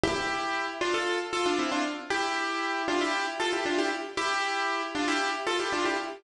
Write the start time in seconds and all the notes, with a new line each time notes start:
0.03 E4 G4
0.81 D4 F4
0.94 F4 A4
1.33 F4 A4
1.46 D4 F4
1.59 C4 E4
1.72 D4 F4
2.10 E4 G4
2.88 D4 F4
3.01 E4 G4
3.40 F4 A4
3.53 E4 G4
3.66 D4 F4
3.78 E4 G4
4.17 E4 G4
4.95 D4 F4
5.08 E4 G4
5.47 F4 A4
5.59 E4 G4
5.72 D4 F4
5.85 E4 G4